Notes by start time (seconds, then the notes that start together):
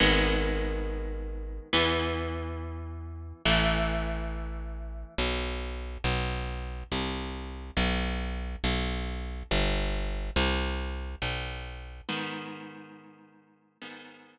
0.00 G#1 D#3 G#3 B3
1.73 E2 E3 B3
3.45 A1 E3 A3
5.18 B1
6.04 B1
6.92 C2
7.77 B1
8.64 B1
9.51 G1
10.36 C2
11.22 B1
12.09 G#2 D#3 B3
13.81 G#2 D#3 B3